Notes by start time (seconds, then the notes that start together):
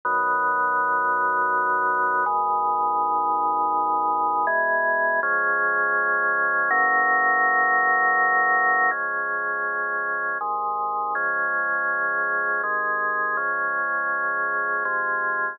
0.05 B2 D#3 F#3
2.26 G#2 B2 D#3
4.47 E2 B2 G#3
5.23 C#3 F3 G#3
6.71 F#2 C#3 E3 A#3
8.91 C#3 F3 G#3
10.41 G#2 C3 D#3
11.15 C#3 F3 G#3
12.63 C3 D#3 G#3
13.37 C#3 F3 G#3
14.85 C3 F3 G#3